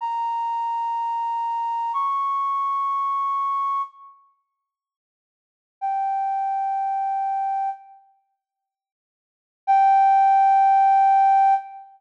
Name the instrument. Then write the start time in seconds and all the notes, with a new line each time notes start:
flute
0.01 A#5
1.93 C#6
5.81 G5
9.67 G5